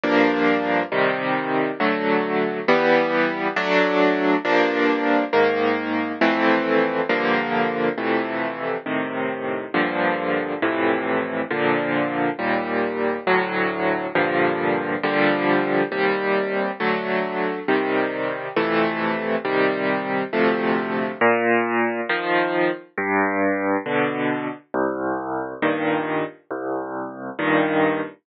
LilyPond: \new Staff { \time 6/8 \key g \minor \tempo 4. = 68 <g, f bes d'>4. <c ees g>4. | <d fis a>4. <e g b>4. | <fis a d'>4. <g, f bes d'>4. | <aes, ees bes>4. <f, e a c'>4. |
<g, d f bes>4. <f, c e a>4. | <a, c ees>4. <g, bes, d f>4. | <f, a, c e>4. <bes, d f>4. | <ees, bes, g>4. <d, a, fis>4. |
<g, bes, d f>4. <bes, d f g>4. | <ees, c g>4. <d fis a>4. | <c ees g>4. <f, c e a>4. | <c ees g>4. <d, c f a>4. |
\key bes \major bes,4. <ees f>4. | g,4. <b, d>4. | c,4. <g, bes, ees>4. | c,4. <g, bes, ees>4. | }